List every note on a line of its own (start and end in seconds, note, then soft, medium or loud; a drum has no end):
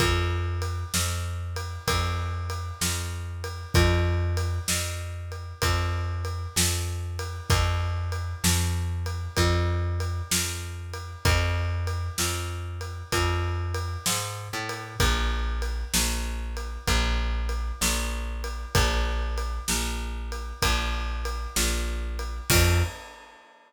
0.00 0.84 F2 medium
0.00 kick medium
0.00 ride medium
0.62 ride medium
0.94 1.78 F2 medium
0.94 snare medium
1.56 ride medium
1.88 2.72 F2 medium
1.88 kick medium
1.88 ride loud
2.50 ride medium
2.81 3.66 F2 medium
2.81 snare medium
3.44 ride medium
3.74 4.59 F2 medium
3.74 kick loud
3.74 ride medium
4.37 ride medium
4.68 5.53 F2 medium
4.68 snare loud
5.32 ride medium
5.62 6.47 F2 medium
5.62 kick medium
5.62 ride medium
6.25 ride medium
6.56 7.41 F2 medium
6.56 snare loud
7.19 ride medium
7.50 8.34 F2 medium
7.50 kick loud
7.50 ride medium
8.12 ride medium
8.44 9.28 F2 medium
8.44 snare loud
9.06 ride medium
9.37 10.22 F2 medium
9.37 kick medium
9.37 ride medium
10.00 ride medium
10.31 11.16 F2 medium
10.31 snare loud
10.94 ride medium
11.25 12.09 F2 medium
11.25 kick loud
11.25 ride medium
11.87 ride medium
12.18 13.03 F2 medium
12.18 snare medium
12.81 ride medium
13.12 13.97 F2 medium
13.12 kick medium
13.12 ride medium
13.74 ride medium
14.06 14.48 G#2 medium
14.06 snare loud
14.53 14.95 A2 medium
14.69 ride medium
15.00 15.84 A#1 medium
15.00 kick medium
15.00 ride loud
15.62 ride medium
15.94 16.78 A#1 medium
15.94 snare loud
16.57 ride medium
16.88 17.72 A#1 medium
16.88 kick medium
16.88 ride medium
17.49 ride medium
17.81 18.66 A#1 medium
17.81 snare loud
18.44 ride medium
18.75 19.59 A#1 medium
18.75 kick loud
18.75 ride loud
19.38 ride medium
19.68 20.53 A#1 medium
19.68 snare medium
20.32 ride medium
20.62 21.47 A#1 medium
20.62 kick medium
20.62 ride loud
21.25 ride medium
21.56 22.41 A#1 medium
21.56 snare loud
22.19 ride medium
22.50 22.83 F2 loud
22.50 kick loud
22.50 crash loud